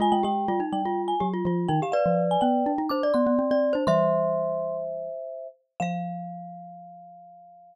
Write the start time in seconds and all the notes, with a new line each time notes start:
0.00 G#3 F4 G#5
0.12 G#3 G5
0.23 G#3 G4 G5
0.48 G3 F4
0.60 D#4
0.72 G3 G5
0.85 F4
1.08 G#5
1.20 F#3 G4
1.33 F4
1.45 F3 F4
1.68 D#3 D#4 G5
1.82 G4 F5
1.92 B4 D5 F5
2.06 F3
2.31 G#5
2.41 B3 G5
2.66 D4
2.78 D#4
2.89 D4 C5 D6
3.03 D5
3.14 B3 C6
3.27 B3
3.39 C4
3.51 C4 D5
3.73 D4 C5
3.87 E3 G3 C5 E5 C6
5.80 F3 F5